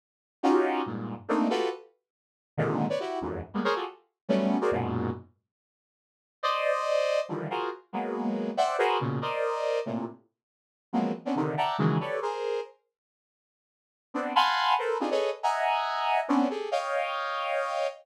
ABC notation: X:1
M:3/4
L:1/16
Q:1/4=140
K:none
V:1 name="Lead 2 (sawtooth)"
z4 [_D_EF_G=G]4 [G,,_A,,_B,,]3 z | [A,_B,CD_E]2 [F_G=GA=B]2 z8 | [_A,,_B,,C,D,_E,]3 [=B_d=d] [=E_G=G]2 [E,,F,,_G,,A,,]2 z [=G,_A,_B,=B,] [_A_Bc_d] [F_G=GA=A] | z4 [_G,=G,A,B,_D]3 [_G_A_Bc=d] [_G,,_A,,_B,,=B,,]4 |
z12 | [cd_e]8 [D,_E,=E,F,G,]2 [F_G_A_Bc]2 | z2 [_G,_A,_B,=B,]6 [cde_g=g]2 [_G_A_B=Bc]2 | [_B,,=B,,_D,]2 [_Bc=d_e]6 [A,,_B,,C,]2 z2 |
z6 [F,_G,_A,_B,=B,C]2 z [B,C_D=D] [C,D,_E,]2 | [de_g=ga_b]2 [_D,_E,=E,_G,_A,]2 [=G=A=B_d=d]2 [_A_Bc]4 z2 | z12 | [B,CD]2 [f_g_a=abc']4 [A_B=Bc]2 [CD_EF=G_A] [A=AB_d_e]2 z |
[_e=e_g_a_b]8 [=B,C_D=D]2 [=G_A=A]2 | [_d_efg]12 |]